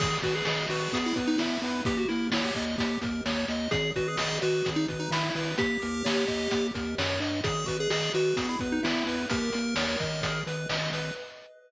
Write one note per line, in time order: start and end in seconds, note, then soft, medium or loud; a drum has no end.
0.00 0.18 G#1 medium
0.00 0.18 G#4 loud
0.00 0.21 G#4 loud
0.00 kick loud
0.00 crash loud
0.22 0.42 G#1 medium
0.22 0.34 F#4 loud
0.22 0.44 B4 medium
0.22 kick medium
0.22 closed hi-hat medium
0.35 0.46 G#4 loud
0.45 0.67 G#1 medium
0.45 0.66 G#4 loud
0.45 0.68 D#5 medium
0.45 snare loud
0.69 0.88 G#1 medium
0.69 0.98 F#4 medium
0.69 0.91 B4 medium
0.69 closed hi-hat medium
0.93 1.13 E2 medium
0.93 1.14 G#4 loud
0.93 kick medium
0.93 closed hi-hat loud
1.06 1.17 E4 medium
1.16 1.36 E2 medium
1.16 1.37 B4 medium
1.16 kick medium
1.16 closed hi-hat medium
1.27 1.38 D#4 loud
1.38 1.58 E2 medium
1.38 1.82 E4 medium
1.38 1.60 E5 medium
1.38 snare loud
1.62 1.82 E2 medium
1.62 1.84 B4 medium
1.62 closed hi-hat medium
1.85 2.05 D#2 medium
1.85 2.07 G4 medium
1.85 1.97 G4 loud
1.85 kick loud
1.85 closed hi-hat loud
1.97 2.08 F#4 medium
2.09 2.30 D#2 medium
2.09 2.28 E4 loud
2.09 2.30 A#4 medium
2.09 closed hi-hat medium
2.31 2.51 D#2 medium
2.31 2.44 E4 loud
2.31 2.54 C#5 medium
2.31 snare loud
2.44 2.65 G4 medium
2.55 2.76 D#2 medium
2.55 2.76 D#5 medium
2.55 kick medium
2.55 closed hi-hat medium
2.78 2.98 D#2 medium
2.78 2.99 G4 loud
2.78 kick medium
2.78 closed hi-hat loud
3.01 3.21 D#2 medium
3.01 3.23 A#4 medium
3.01 kick loud
3.01 closed hi-hat medium
3.26 3.45 D#2 medium
3.26 3.47 C#5 medium
3.26 snare loud
3.48 3.68 D#2 medium
3.48 3.70 D#5 medium
3.48 closed hi-hat medium
3.71 3.92 G#1 loud
3.71 3.91 G#4 loud
3.71 3.93 G#4 medium
3.71 kick loud
3.71 closed hi-hat loud
3.96 4.16 G#1 medium
3.96 4.07 F#4 loud
3.96 4.17 B4 medium
3.96 kick medium
3.96 closed hi-hat medium
4.08 4.18 G#4 medium
4.17 4.39 G#1 medium
4.17 4.38 G#4 loud
4.17 4.40 D#5 medium
4.17 snare loud
4.41 4.62 G#1 medium
4.41 4.70 F#4 medium
4.41 4.63 B4 medium
4.41 closed hi-hat medium
4.65 4.86 G#1 loud
4.65 4.85 G#4 medium
4.65 kick medium
4.65 closed hi-hat loud
4.76 4.87 D#4 loud
4.88 5.09 G#1 medium
4.88 5.10 B4 medium
4.88 kick medium
4.88 closed hi-hat medium
5.00 5.11 D#4 loud
5.11 5.30 G#1 medium
5.11 5.52 E4 loud
5.11 5.32 E5 medium
5.11 snare loud
5.34 5.55 G#1 medium
5.34 5.56 B4 medium
5.34 open hi-hat medium
5.58 5.78 D#2 medium
5.58 6.67 G4 loud
5.58 5.80 G4 medium
5.58 kick loud
5.58 closed hi-hat loud
5.82 6.03 D#2 medium
5.82 6.03 A#4 medium
5.82 closed hi-hat medium
6.04 6.25 D#2 medium
6.04 6.25 C#5 medium
6.04 snare loud
6.27 6.48 D#2 medium
6.27 6.49 D#5 medium
6.27 kick medium
6.27 closed hi-hat medium
6.51 6.71 D#2 medium
6.51 6.72 G4 medium
6.51 kick medium
6.51 closed hi-hat loud
6.74 6.95 D#2 medium
6.74 6.95 A#4 medium
6.74 kick medium
6.74 closed hi-hat medium
6.98 7.20 F#2 medium
6.98 7.19 C#5 medium
6.98 snare loud
7.20 7.41 G2 medium
7.20 7.41 D#5 medium
7.20 closed hi-hat medium
7.44 7.65 G#1 medium
7.44 7.65 G#4 medium
7.44 7.66 G#4 loud
7.44 kick loud
7.44 closed hi-hat loud
7.66 7.88 G#1 medium
7.66 7.77 F#4 loud
7.66 7.88 B4 medium
7.66 kick medium
7.66 closed hi-hat medium
7.80 7.90 G#4 medium
7.90 8.10 G#1 medium
7.90 8.13 G#4 loud
7.90 8.12 D#5 medium
7.90 snare loud
8.14 8.34 G#1 medium
8.14 8.47 F#4 loud
8.14 8.36 B4 medium
8.14 closed hi-hat medium
8.36 8.56 E2 medium
8.36 8.58 G#4 loud
8.36 kick loud
8.36 closed hi-hat loud
8.49 8.60 E4 loud
8.59 8.80 E2 medium
8.59 8.81 B4 medium
8.59 kick loud
8.59 closed hi-hat medium
8.72 8.83 D#4 loud
8.83 9.04 E2 medium
8.83 9.22 E4 loud
8.83 9.04 E5 medium
8.83 snare loud
9.06 9.26 E2 medium
9.06 9.28 B4 medium
9.06 closed hi-hat medium
9.30 9.50 D#2 medium
9.30 9.52 G4 medium
9.30 10.41 A#4 loud
9.30 kick loud
9.30 closed hi-hat loud
9.53 9.75 D#2 medium
9.53 9.74 A#4 medium
9.53 closed hi-hat medium
9.76 9.96 D#2 medium
9.76 9.98 C#5 medium
9.76 snare loud
10.00 10.43 G#1 medium
10.00 10.21 D#5 medium
10.00 kick medium
10.00 closed hi-hat medium
10.22 10.44 G#4 medium
10.22 kick medium
10.22 closed hi-hat loud
10.47 10.66 G#1 medium
10.47 10.68 B4 medium
10.47 closed hi-hat medium
10.69 10.90 G#1 medium
10.69 10.91 D#5 medium
10.69 snare loud
10.91 11.11 G#1 medium
10.91 11.14 B4 medium
10.91 closed hi-hat medium